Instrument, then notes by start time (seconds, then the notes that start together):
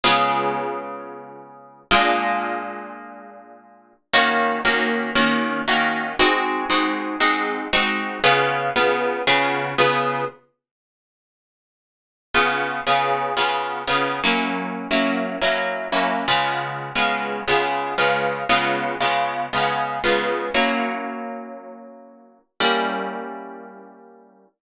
acoustic guitar (steel)
0.04 C#3 G#3 B3 F4
1.91 A#2 G#3 D4 F4
4.13 D#3 A#3 C#4 F#4
4.65 D#3 A#3 C#4 F#4
5.15 D#3 A#3 C#4 F#4
5.68 D#3 A#3 C#4 F#4
6.19 G#3 C4 D#4 F#4
6.70 G#3 C4 D#4 F#4
7.20 G#3 C4 D#4 F#4
7.73 G#3 C4 D#4 F#4
8.24 C#3 B3 F4 G#4
8.76 C#3 B3 F4 G#4
9.27 C#3 B3 F4 G#4
9.78 C#3 B3 F4 G#4
12.34 C#3 B3 F4 G#4
12.87 C#3 B3 F4 G#4
13.37 C#3 B3 F4 G#4
13.87 C#3 B3 F4 G#4
14.24 F#3 A#3 C#4 E4
14.91 F#3 A#3 C#4 E4
15.42 F#3 A#3 C#4 E4
15.92 F#3 A#3 C#4 E4
16.28 C#3 G#3 B3 F4
16.95 C#3 G#3 B3 F4
17.48 C#3 G#3 B3 F4
17.98 C#3 G#3 B3 F4
18.49 C#3 G#3 B3 F4
19.00 C#3 G#3 B3 F4
19.53 C#3 G#3 B3 F4
20.04 C#3 G#3 B3 F4
20.54 F#3 A#3 C#4 E4
22.60 G3 A#3 C#4 E4